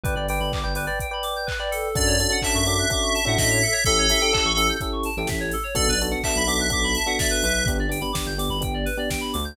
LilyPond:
<<
  \new Staff \with { instrumentName = "Electric Piano 2" } { \time 4/4 \key d \major \tempo 4 = 126 r1 | d''4 e''2 e''4 | a'2 r2 | d''8 r8 e''2 e''4 |
r1 | }
  \new Staff \with { instrumentName = "Electric Piano 1" } { \time 4/4 \key d \major <b' d'' g''>16 <b' d'' g''>16 <b' d'' g''>8. <b' d'' g''>16 <b' d'' g''>16 <b' d'' g''>8 <b' d'' g''>4 <b' d'' g''>8. | <cis' d' fis' a'>8 <cis' d' fis' a'>16 <cis' d' fis' a'>16 <cis' d' fis' a'>8 <cis' d' fis' a'>8 <cis' d' fis' a'>8. <cis' d' fis' a'>4~ <cis' d' fis' a'>16 | <cis' e' g' a'>8 <cis' e' g' a'>16 <cis' e' g' a'>16 <cis' e' g' a'>8 <cis' e' g' a'>8 <cis' e' g' a'>8. <cis' e' g' a'>4~ <cis' e' g' a'>16 | <b d' fis' a'>8 <b d' fis' a'>16 <b d' fis' a'>16 <b d' fis' a'>8 <b d' fis' a'>8 <b d' fis' a'>8. <b d' fis' a'>4~ <b d' fis' a'>16 |
<b d' g'>8 <b d' g'>16 <b d' g'>16 <b d' g'>8 <b d' g'>8 <b d' g'>8. <b d' g'>4~ <b d' g'>16 | }
  \new Staff \with { instrumentName = "Electric Piano 2" } { \time 4/4 \key d \major b'16 d''16 g''16 b''16 d'''16 g'''16 b'16 d''16 g''16 b''16 d'''16 g'''16 b'16 d''16 a'8~ | a'16 cis''16 d''16 fis''16 a''16 cis'''16 d'''16 fis'''16 d'''16 cis'''16 a''16 fis''16 dis''16 cis''16 a'16 cis''16 | a'16 cis''16 e''16 g''16 a''16 cis'''16 e'''16 g'''16 e'''16 cis'''16 a''16 g''16 e''16 cis''16 a'16 cis''16 | a'16 b'16 d''16 fis''16 a''16 b''16 d'''16 fis'''16 d'''16 b''16 a''16 fis''16 d''16 b'16 b'8~ |
b'16 d''16 g''16 b''16 d'''16 g'''16 d'''16 b''16 g''16 d''16 b'16 d''16 g''16 b''16 d'''16 g'''16 | }
  \new Staff \with { instrumentName = "Synth Bass 2" } { \clef bass \time 4/4 \key d \major g,,16 g,,8 g,,8 g,,2~ g,,8. | fis,4~ fis,16 fis,4. a,16 a,4 | a,,4~ a,,16 a,,4. a,,16 a,,4 | b,,16 b,,4 b,,8 b,,16 b,,4. b,,8 |
g,,16 g,,4 g,,8 g,,16 g,,4. d,8 | }
  \new DrumStaff \with { instrumentName = "Drums" } \drummode { \time 4/4 <hh bd>8 hho8 <hc bd>8 hho8 <hh bd>8 hho8 <hc bd>8 hho8 | <hh bd>8 hho8 <hc bd>8 hho8 <hh bd>8 hho8 <bd sn>8 hho8 | <hh bd>8 hho8 <hc bd>8 hho8 <hh bd>8 hho8 <bd sn>8 hho8 | <hh bd>8 hho8 <hc bd>8 hho8 <hh bd>8 hho8 <bd sn>8 hho8 |
<hh bd>8 hho8 <bd sn>8 hho8 <hh bd>8 hho8 <bd sn>8 hho8 | }
>>